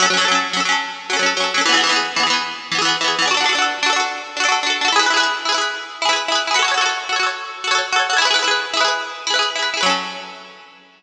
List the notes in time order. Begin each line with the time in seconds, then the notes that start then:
0.00 F#3 C#4
0.06 A4
0.10 F#3 C#4
0.17 F#3 A4
0.21 C#4 A4
0.28 F#3 C#4
0.35 A4
0.53 F#3 C#4
0.60 A4
0.65 F#3 C#4
0.72 A4
1.10 F#3 C#4
1.17 F#3 A4
1.23 C#4 A4
1.37 F#3 C#4
1.44 A4
1.54 F#3 C#4
1.61 A4
1.66 E3 B3
1.72 E3 G#4
1.77 B3 G#4
1.83 E3 B3
1.89 E3 B3 G#4
1.96 G#4
2.16 E3 B3
2.23 E3 G#4
2.30 B3 G#4
2.72 E3 B3
2.78 E3 G#4
2.85 B3 G#4
3.01 E3 B3
3.08 G#4
3.19 E3 B3
3.26 D4 G#4
3.31 F#4 A4
3.37 D4 F#4
3.44 D4 A4
3.49 F#4 A4
3.55 D4 F#4
3.62 A4
3.83 D4 F#4
3.90 D4 A4
3.96 F#4 A4
4.37 D4 F#4
4.44 D4 A4
4.48 F#4 A4
4.63 D4 F#4
4.70 A4
4.81 D4 F#4
4.88 A4
4.92 E4 G#4
4.99 E4 G#4 B4
5.06 E4 B4
5.14 E4 G#4 B4
5.20 G#4 B4
5.45 E4 G#4
5.52 E4 B4
5.58 G#4 B4
6.02 E4 G#4
6.09 E4 G#4 B4
6.16 B4
6.28 E4 G#4
6.35 B4
6.47 E4 G#4
6.54 F#4 B4
6.59 A4 C#5
6.64 F#4 A4
6.71 F#4 C#5
6.78 A4 C#5
6.82 F#4 A4
6.89 C#5
7.09 F#4 A4
7.16 F#4 C#5
7.23 A4 C#5
7.64 F#4 A4
7.71 F#4 A4 C#5
7.78 C#5
7.92 F#4 A4
7.99 C#5
8.10 F#4 A4
8.17 E4 C#5
8.22 G#4 B4
8.27 E4 G#4
8.34 E4 B4
8.39 G#4 B4
8.44 E4 G#4
8.51 B4
8.74 E4 G#4
8.81 E4 B4
8.85 G#4 B4
9.27 E4 G#4
9.34 E4 B4
9.39 G#4 B4
9.56 E4 G#4
9.62 B4
9.74 E4 G#4
9.81 F#3 B4
9.86 C#4 A4